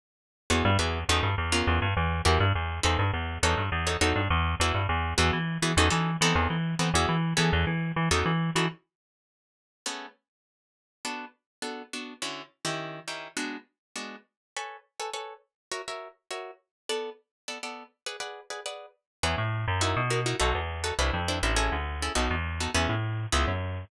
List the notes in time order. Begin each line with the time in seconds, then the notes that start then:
0.50 E2 B3 E4 F#4 G#4
0.65 G2
0.79 E2 B3 E4 F#4 G#4
1.09 E2 C#4 D#4 F#4 A4
1.23 G2
1.38 E2
1.52 B3 C#4 F4 A#4
1.67 E2
1.82 G2
1.97 E2
2.25 E2 E4 F#4 G4 A#4
2.40 G2
2.55 E2
2.83 E2 D#4 A4 B4 C5
2.99 G2
3.13 E2
3.43 E2 D#4 F#4 A4 C#5
3.57 G2
3.72 E2
3.87 D#4 F#4 A4 C#5
4.01 E2 D#4 F#4 A4 C#5
4.16 G2
4.30 E2
4.60 E2 E4 F#4 G#4 B4
4.74 G2
4.89 E2
5.18 E2 B3 E4 F#4 G#4
5.33 E3
5.62 E3 B3 E4 F#4 G#4
5.77 E2 C#4 D#4 F#4 A4
5.90 E3 C#4 D#4 F#4 A4
6.21 E3 B3 C4 D#4 A4
6.35 E2
6.50 E3
6.79 E3 B3 C4 D#4 A4
6.94 E2 B3 E4 F#4 G#4
7.09 E3
7.37 E3 B3 C#4 G#4 A4
7.53 E2
7.67 E3
7.96 E3
8.11 E2 C#4 D#4 F#4 A4
8.26 E3
8.55 E3 C#4 D#4 F#4 A4
9.86 A3 B3 C#4 G#4
11.05 B3 D4 F#4 A4
11.62 B3 D4 F#4 A4
11.93 B3 D4 F#4 A4
12.22 D3 C#4 E4 F#4
12.65 D#3 C#4 E4 G4
13.08 D#3 C#4 E4 G4
13.37 G#3 B3 D4 F#4
13.96 G#3 B3 D4 F#4
14.56 A4 B4 C#5 G#5
15.00 A4 B4 C#5 G#5
15.13 A4 B4 C#5 G#5
15.71 F#4 A#4 C#5 E5
15.88 F#4 A#4 C#5 E5
16.31 F#4 A#4 C#5 E5
16.89 B3 A4 D5 F#5
17.48 B3 A4 D5 F#5
17.63 B3 A4 D5 F#5
18.06 G#4 B4 D5 F#5
18.20 G#4 B4 D5 F#5
18.50 G#4 B4 D5 F#5
18.66 G#4 B4 D5 F#5
19.23 E2 E4 G#4 B4 C#5
19.38 A2
19.68 F#2
19.81 D#4 E4 F#4 A#4
19.97 B2
20.10 D#4 E4 F#4 A#4
20.26 D#4 E4 F#4 A#4
20.40 B1 D#4 F#4 A4 B4
20.55 E2
20.84 D#4 F#4 A4 B4
20.99 C2 D4 E4 B4 C5
21.13 F2
21.28 D4 E4 B4 C5
21.43 A1 D4 E4 B4 C5
21.56 C#4 E4 G#4 A4
21.72 D2
22.02 C#4 E4 G#4 A4
22.15 B1 B3 D#4 F#4 A4
22.30 E2
22.60 B3 D#4 F#4 A4
22.74 E2 B3 C#4 E4 G#4
22.89 A2
23.32 C#2 B3 C#4 E4 G#4
23.48 F#2